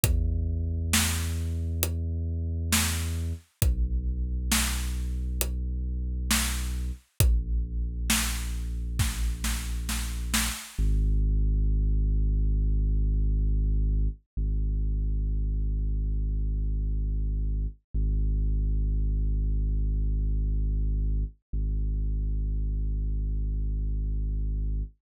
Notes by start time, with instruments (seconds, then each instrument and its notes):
0.03 synth bass 2 E2, kick, closed hi-hat
0.93 snare
1.83 closed hi-hat
2.72 snare
3.62 synth bass 2 B1, kick, closed hi-hat
4.51 snare
5.41 closed hi-hat
6.31 snare
7.20 synth bass 2 A#1, kick, closed hi-hat
8.10 snare
8.99 kick, snare
9.44 snare
9.89 snare
10.34 snare
10.79 synth bass 2 G#1
14.37 synth bass 2 G#1
17.94 synth bass 2 G#1
21.53 synth bass 2 G#1